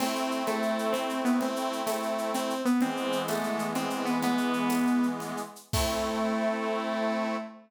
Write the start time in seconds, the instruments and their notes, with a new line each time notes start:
0.00 accordion A3 C4 E4, lead 2 (sawtooth) C4, crash, cowbell, low conga, shaker
0.16 shaker
0.31 shaker
0.46 lead 2 (sawtooth) A3, cowbell, high conga, shaker
0.62 shaker
0.79 shaker
0.92 lead 2 (sawtooth) C4, cowbell, low conga, shaker
1.09 shaker
1.25 lead 2 (sawtooth) B3, shaker
1.41 lead 2 (sawtooth) C4, cowbell, low conga, shaker
1.56 shaker
1.73 shaker
1.86 lead 2 (sawtooth) A3, tambourine, cowbell, high conga, shaker
2.03 shaker
2.18 shaker
2.34 lead 2 (sawtooth) C4, cowbell, low conga, shaker
2.50 shaker
2.65 lead 2 (sawtooth) B3, shaker
2.81 accordion E3 G#3 B3, lead 2 (sawtooth) C4, cowbell, low conga, shaker
2.97 shaker
3.12 shaker
3.28 lead 2 (sawtooth) A3, tambourine, cowbell, high conga, shaker
3.43 shaker
3.59 shaker
3.75 lead 2 (sawtooth) C4, cowbell, low conga, shaker
3.90 shaker
4.05 lead 2 (sawtooth) B3, shaker
4.22 lead 2 (sawtooth) B3, cowbell, low conga, shaker
4.38 shaker
4.53 shaker
4.69 tambourine, cowbell, high conga, shaker
4.87 shaker
5.03 shaker
5.20 cowbell, low conga, shaker
5.37 shaker
5.56 shaker
5.73 lead 2 (sawtooth) A3, accordion A3 C4 E4, kick, crash